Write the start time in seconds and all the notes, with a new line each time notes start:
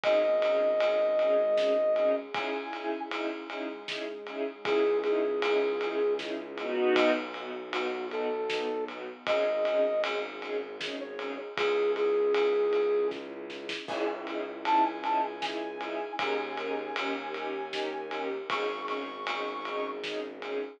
0.04 G#1 C#4 D#4 G#4 D#5, kick, ride
0.42 C#4 D#4 G#4, ride
0.80 C#4 D#4 G#4, ride
1.18 G#3 C#4 D#4 G#4, ride
1.57 C#4 D#4 G#4, snare
1.96 C#4 D#4 G#4, ride
2.34 C#4 D#4 E4 G#4 G#5, kick, ride
2.73 C#4 D#4 E4 G#4, ride
3.11 C#4 D#4 E4 G#4, ride
3.49 G#3 C#4 D#4 E4 G#4, ride
3.88 C#4 D#4 E4 G#4, snare
4.27 C#4 D#4 E4 G#4, ride
4.65 C#2 C#4 D#4 E4 G#4, kick, ride
5.04 C#4 D#4 E4 G#4, ride
5.42 C#4 D#4 E4 G#4, ride
5.81 C#4 D#4 E4 G#4, ride
6.19 C#4 D#4 E4 G#4, snare
6.58 B3 D#4 F#4, ride
6.96 B1 B3 D#4 F#4, kick, ride
7.34 B3 D#4 F#4, ride
7.73 B3 D#4 F#4, ride
8.11 B3 D#4 F#4 A4, ride
8.50 B3 D#4 F#4, snare
8.88 B3 D#4 F#4, ride
9.27 G#1 C#4 D#4 G#4 D#5, kick, ride
9.65 C#4 D#4 G#4, ride
10.04 C#4 D#4 G#4, ride
10.41 C#4 D#4 G#4, ride
10.80 C#4 D#4 G#4, snare
11.00 C#5
11.18 C#4 D#4 G#4, ride
11.57 C#2 C#4 D#4 E4 G#4, kick, ride
11.96 G#4, ride
12.34 ride
12.73 ride
13.11 kick, snare
13.50 snare
13.69 snare
13.88 C#2 C#4 D#4 E4 G#4 G#5, kick, crash
14.26 C#4 D#4 E4 G#4, ride
14.65 C#4 D#4 E4 G#4 A5, ride
14.84 G#5
15.04 C#4 D#4 E4 G#4 A5, ride
15.23 G#5
15.42 C#4 D#4 E4 G#4 G#5, snare
15.81 C#4 D#4 E4 G#4, ride
16.18 D#2 C#4 D#4 G#4 A#4 G#5, kick, ride
16.58 C#4 D#4 G#4 A#4, ride
16.96 D#2 C#4 D#4 G4 A#4, ride
17.34 C#4 D#4 G4 A#4, ride
17.73 C#4 D#4 G4 A#4, snare
18.11 C#4 D#4 G4 A#4, ride
18.50 G#1 C#4 D#4 G#4 C#6, kick, ride
18.88 C#4 D#4 G#4 C#6, ride
19.27 C#4 D#4 G#4, ride
19.65 C#4 D#4 G#4, ride
20.04 C#4 D#4 G#4, snare
20.42 C#4 D#4 G#4, ride